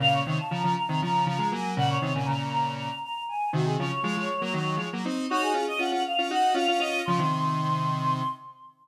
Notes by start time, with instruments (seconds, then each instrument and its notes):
0.00 lead 1 (square) A#2 C#3, choir aahs F5
0.13 choir aahs C#5
0.26 lead 1 (square) C3 D#3
0.38 choir aahs A5
0.51 lead 1 (square) C#3 F3, choir aahs A#5
0.63 lead 1 (square) C#3 F3
0.76 choir aahs A#5
0.89 lead 1 (square) C3 D#3
1.01 lead 1 (square) C#3 F3, choir aahs A#5
1.26 lead 1 (square) C#3 F3, choir aahs A#5
1.38 lead 1 (square) F3 G#3
1.52 lead 1 (square) F#3 A#3, choir aahs G#5
1.77 lead 1 (square) A#2 C#3, choir aahs F#5
1.89 choir aahs C#5
2.02 lead 1 (square) C3 D#3
2.15 lead 1 (square) A#2 C#3, choir aahs G#5
2.26 lead 1 (square) A#2 C#3, choir aahs A#5
2.51 choir aahs A#5
2.78 choir aahs A#5
3.03 choir aahs A#5
3.28 choir aahs G#5
3.53 lead 1 (square) C3 D#3, choir aahs F#4
3.65 choir aahs G#4
3.78 lead 1 (square) C#3 F3, choir aahs C#5
4.03 lead 1 (square) F3 G#3
4.17 lead 1 (square) F3 G#3
4.41 lead 1 (square) F#3 A#3
4.53 lead 1 (square) D#3 F#3
4.77 lead 1 (square) F3 G#3
4.93 lead 1 (square) F#3 A#3
5.05 lead 1 (square) C4 D#4
5.30 lead 1 (square) D#4 F#4, choir aahs C#5
5.42 choir aahs G#4
5.54 lead 1 (square) C#4 F4
5.68 choir aahs D#5
5.79 lead 1 (square) C#4 F4, choir aahs F#5
5.92 lead 1 (square) C#4 F4
6.05 choir aahs F5
6.18 lead 1 (square) C#4 F4
6.30 lead 1 (square) D#4 F#4, choir aahs F#5
6.54 lead 1 (square) C#4 F4, choir aahs F5
6.68 lead 1 (square) C#4 F4
6.79 lead 1 (square) C#4 F4, choir aahs D#5
7.05 lead 1 (square) C#3 F3, choir aahs C6
7.19 lead 1 (square) C3 D#3